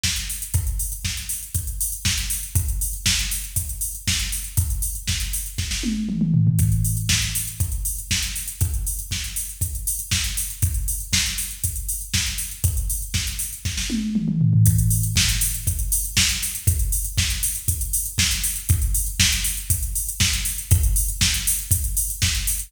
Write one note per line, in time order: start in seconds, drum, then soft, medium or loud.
0.03 kick medium
0.03 snare medium
0.16 closed hi-hat medium
0.30 open hi-hat medium
0.42 closed hi-hat medium
0.54 kick medium
0.54 closed hi-hat medium
0.67 closed hi-hat soft
0.79 open hi-hat medium
0.92 closed hi-hat medium
1.05 kick medium
1.05 snare medium
1.17 closed hi-hat soft
1.29 open hi-hat medium
1.43 closed hi-hat soft
1.55 kick medium
1.55 closed hi-hat medium
1.67 closed hi-hat medium
1.81 open hi-hat medium
1.92 closed hi-hat medium
2.05 kick medium
2.05 snare medium
2.18 closed hi-hat medium
2.30 open hi-hat medium
2.43 closed hi-hat medium
2.55 kick medium
2.55 closed hi-hat medium
2.68 closed hi-hat medium
2.81 open hi-hat medium
2.93 closed hi-hat medium
3.06 kick medium
3.06 snare medium
3.19 closed hi-hat soft
3.31 open hi-hat medium
3.44 closed hi-hat soft
3.56 kick medium
3.56 closed hi-hat medium
3.69 closed hi-hat medium
3.81 open hi-hat medium
3.95 closed hi-hat soft
4.07 kick medium
4.07 snare medium
4.19 closed hi-hat soft
4.32 open hi-hat medium
4.44 closed hi-hat medium
4.57 kick medium
4.57 closed hi-hat medium
4.70 closed hi-hat medium
4.82 open hi-hat medium
4.95 closed hi-hat soft
5.08 kick medium
5.08 snare medium
5.20 closed hi-hat medium
5.33 open hi-hat medium
5.46 closed hi-hat soft
5.58 kick medium
5.58 snare medium
5.71 snare medium
5.83 high tom medium
6.09 mid tom medium
6.21 mid tom medium
6.34 floor tom medium
6.47 floor tom medium
6.59 kick medium
6.59 closed hi-hat medium
6.72 closed hi-hat soft
6.85 open hi-hat medium
6.97 closed hi-hat medium
7.09 kick medium
7.09 snare medium
7.22 closed hi-hat soft
7.35 open hi-hat medium
7.47 closed hi-hat medium
7.60 kick medium
7.60 closed hi-hat medium
7.72 closed hi-hat medium
7.85 open hi-hat medium
7.98 closed hi-hat medium
8.11 kick medium
8.11 snare medium
8.22 closed hi-hat medium
8.36 open hi-hat medium
8.48 closed hi-hat medium
8.61 kick medium
8.61 closed hi-hat medium
8.74 closed hi-hat soft
8.87 open hi-hat medium
8.99 closed hi-hat medium
9.11 kick medium
9.11 snare medium
9.24 closed hi-hat soft
9.36 open hi-hat medium
9.49 closed hi-hat soft
9.61 kick medium
9.61 closed hi-hat medium
9.75 closed hi-hat medium
9.87 open hi-hat medium
9.99 closed hi-hat medium
10.11 kick medium
10.11 snare medium
10.24 closed hi-hat medium
10.37 open hi-hat medium
10.50 closed hi-hat medium
10.62 kick medium
10.62 closed hi-hat medium
10.74 closed hi-hat medium
10.88 open hi-hat medium
11.00 closed hi-hat medium
11.13 kick medium
11.13 snare medium
11.26 closed hi-hat soft
11.38 open hi-hat medium
11.51 closed hi-hat soft
11.64 kick medium
11.64 closed hi-hat medium
11.76 closed hi-hat medium
11.89 open hi-hat medium
12.01 closed hi-hat soft
12.14 kick medium
12.14 snare medium
12.26 closed hi-hat soft
12.38 open hi-hat medium
12.51 closed hi-hat medium
12.64 kick medium
12.64 closed hi-hat medium
12.77 closed hi-hat medium
12.90 open hi-hat medium
13.02 closed hi-hat soft
13.14 kick medium
13.14 snare medium
13.27 closed hi-hat medium
13.39 open hi-hat medium
13.53 closed hi-hat soft
13.65 kick medium
13.65 snare medium
13.77 snare medium
13.90 high tom medium
14.15 mid tom medium
14.28 mid tom medium
14.41 floor tom medium
14.53 floor tom medium
14.66 kick medium
14.66 closed hi-hat medium
14.78 closed hi-hat medium
14.90 open hi-hat medium
15.03 closed hi-hat medium
15.16 kick medium
15.16 snare loud
15.29 closed hi-hat medium
15.41 open hi-hat medium
15.54 closed hi-hat medium
15.67 kick medium
15.67 closed hi-hat medium
15.79 closed hi-hat medium
15.92 open hi-hat medium
16.04 closed hi-hat medium
16.17 kick medium
16.17 snare loud
16.29 closed hi-hat medium
16.43 open hi-hat medium
16.55 closed hi-hat medium
16.67 kick medium
16.67 closed hi-hat medium
16.79 closed hi-hat medium
16.92 open hi-hat medium
17.05 closed hi-hat medium
17.18 kick medium
17.18 snare medium
17.30 closed hi-hat medium
17.43 open hi-hat medium
17.55 closed hi-hat medium
17.68 kick medium
17.68 closed hi-hat medium
17.81 closed hi-hat medium
17.93 open hi-hat medium
18.05 closed hi-hat medium
18.18 kick medium
18.18 snare medium
18.31 closed hi-hat medium
18.44 open hi-hat medium
18.56 closed hi-hat medium
18.69 kick medium
18.69 closed hi-hat medium
18.82 closed hi-hat medium
18.94 open hi-hat medium
19.06 closed hi-hat medium
19.20 kick medium
19.20 snare loud
19.32 closed hi-hat medium
19.44 open hi-hat medium
19.57 closed hi-hat medium
19.70 kick medium
19.70 closed hi-hat medium
19.83 closed hi-hat medium
19.95 open hi-hat medium
20.09 closed hi-hat medium
20.20 kick medium
20.20 snare medium
20.33 closed hi-hat medium
20.45 open hi-hat medium
20.58 closed hi-hat medium
20.71 kick loud
20.71 closed hi-hat medium
20.83 closed hi-hat medium
20.96 open hi-hat medium
21.08 closed hi-hat medium
21.21 kick medium
21.21 snare medium
21.34 closed hi-hat medium
21.47 open hi-hat medium
21.59 closed hi-hat medium
21.71 kick medium
21.71 closed hi-hat loud
21.84 closed hi-hat medium
21.97 open hi-hat medium
22.10 closed hi-hat medium
22.22 kick medium
22.22 snare medium
22.35 closed hi-hat medium
22.47 open hi-hat medium
22.59 closed hi-hat medium